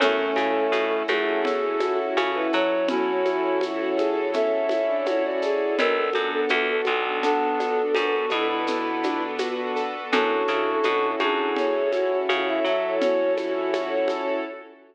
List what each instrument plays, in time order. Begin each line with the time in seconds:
0.00 electric bass (finger) F#2, clarinet A3 C#4, acoustic grand piano C#4, string ensemble 1 C#4 E4 F#4 A4, violin A4, low conga, shaker
0.36 electric bass (finger) C#3, acoustic grand piano E4, high conga, shaker
0.72 electric bass (finger) B2, acoustic grand piano F#4, high conga, shaker
1.08 electric bass (finger) F#2, clarinet A3, violin G#4, acoustic grand piano A4, high conga, shaker
1.44 acoustic grand piano C#4, clarinet A4, low conga, shaker
1.80 acoustic grand piano E4, violin F#4, high conga, shaker
1.99 violin F#4
2.17 electric bass (finger) C#3, acoustic grand piano F#4, high conga, shaker
2.34 violin E4, clarinet B4
2.53 electric bass (finger) F#3, acoustic grand piano A4, clarinet C#5, shaker
2.88 clarinet C#4 E4, string ensemble 1 C#4 E4 A4 C#5, acoustic grand piano C#4, violin F#4, low conga, shaker
3.25 acoustic grand piano E4, high conga, shaker
3.61 violin E4, acoustic grand piano F#4, high conga, shaker
3.79 violin F#4
3.97 violin G#4, acoustic grand piano A4, high conga, shaker
4.33 acoustic grand piano C#4, violin A4, clarinet E5, low conga, shaker
4.69 acoustic grand piano E4, high conga, shaker
4.88 violin D4
5.06 violin E4, acoustic grand piano F#4, clarinet C#5, high conga, shaker
5.24 violin F#4, clarinet D5
5.42 violin G#4, acoustic grand piano A4, shaker
5.78 electric bass (finger) B1, acoustic grand piano B3, string ensemble 1 B3 D4 F#4 A4, clarinet A4, violin A#4, low conga, shaker
5.96 violin A4
6.13 electric bass (finger) F#2, acoustic grand piano D4, high conga, shaker
6.32 violin A4
6.49 electric bass (finger) E2, acoustic grand piano F#4, violin A4, high conga, shaker
6.68 violin A4
6.85 electric bass (finger) B1, violin A4, acoustic grand piano A4, high conga, shaker
7.23 clarinet B3 D4, acoustic grand piano B3, violin A4, low conga, shaker
7.59 acoustic grand piano D4, high conga, shaker
7.95 electric bass (finger) F#2, string ensemble 1 B3 D4 A4 B4, clarinet F#4, acoustic grand piano F#4, high conga, shaker
8.30 electric bass (finger) B2, clarinet E4, acoustic grand piano A4, high conga, shaker
8.49 clarinet E4
8.67 acoustic grand piano B3, low conga, shaker
9.03 acoustic grand piano D4, high conga, shaker
9.38 acoustic grand piano F#4, high conga, shaker
9.76 acoustic grand piano A4, shaker
10.12 electric bass (finger) F#2, acoustic grand piano C#4, string ensemble 1 C#4 E4 F#4 A4, clarinet D4 F#4, violin A4, low conga, shaker
10.48 electric bass (finger) C#3, acoustic grand piano E4, high conga, shaker
10.83 electric bass (finger) B2, acoustic grand piano F#4, high conga, shaker
11.20 electric bass (finger) F#2, clarinet D4, violin G#4, acoustic grand piano A4, high conga, shaker
11.56 acoustic grand piano C#4, clarinet C#5, low conga, shaker
11.92 acoustic grand piano E4, violin F#4, high conga, shaker
12.11 violin F#4
12.29 electric bass (finger) C#3, string ensemble 1 C#4 E4 A4 C#5, acoustic grand piano F#4, high conga, shaker
12.47 violin E4, clarinet E5
12.64 electric bass (finger) F#3, acoustic grand piano A4, clarinet E5, shaker
13.01 acoustic grand piano C#4, violin F#4, clarinet C#5, low conga, shaker
13.37 acoustic grand piano E4, high conga, shaker
13.73 acoustic grand piano F#4, high conga, shaker
14.08 acoustic grand piano A4, high conga, shaker